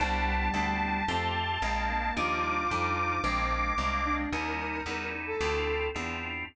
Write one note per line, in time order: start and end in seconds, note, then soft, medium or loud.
0.00 0.49 C2 loud
0.00 1.03 G3 loud
0.00 0.49 B3 loud
0.00 0.49 C4 medium
0.00 0.49 D4 medium
0.00 0.49 E4 medium
0.00 2.14 A5 medium
0.54 1.02 D2 medium
0.54 1.03 B3 medium
0.54 1.03 C4 medium
0.54 1.03 D4 medium
0.54 1.03 E4 medium
1.08 1.58 F2 loud
1.08 1.57 A3 medium
1.08 1.30 C4 loud
1.08 1.57 C4 medium
1.08 1.57 F4 medium
1.08 1.57 G4 medium
1.62 2.12 A#1 medium
1.62 2.11 G#3 medium
1.62 2.11 A#3 medium
1.62 2.11 C4 medium
1.62 2.11 D4 medium
1.90 2.16 A#3 loud
2.16 2.65 D#2 loud
2.16 2.65 F3 medium
2.16 2.65 G3 medium
2.16 2.65 D4 loud
2.16 2.65 D#4 medium
2.16 3.18 F4 loud
2.16 4.15 D6 medium
2.70 3.20 F2 medium
2.70 3.19 F3 medium
2.70 3.19 G3 medium
2.70 3.19 D4 medium
2.70 3.19 D#4 medium
3.24 3.72 A#1 loud
3.24 3.73 G#3 medium
3.24 3.73 A#3 medium
3.24 3.47 C4 loud
3.24 3.73 C4 medium
3.24 3.73 D4 medium
3.78 4.26 C2 medium
3.78 4.27 G#3 medium
3.78 4.27 A#3 medium
3.78 4.27 C4 medium
3.78 4.27 D4 medium
4.05 4.30 D4 loud
4.32 4.81 D#2 loud
4.32 4.81 G3 medium
4.32 4.81 C#4 medium
4.32 4.81 D#4 loud
4.32 4.81 E4 medium
4.32 5.08 A#4 loud
4.86 5.35 E2 medium
4.86 5.35 G3 medium
4.86 5.35 C#4 medium
4.86 5.35 D#4 medium
4.86 5.35 E4 medium
5.27 5.86 A4 loud
5.41 5.89 D2 loud
5.41 5.89 C4 medium
5.41 5.89 D4 medium
5.41 5.89 E4 loud
5.41 5.89 F4 medium
5.94 6.44 E2 medium
5.94 6.43 C4 medium
5.94 6.43 D4 medium
5.94 6.43 E4 medium
5.94 6.43 F4 medium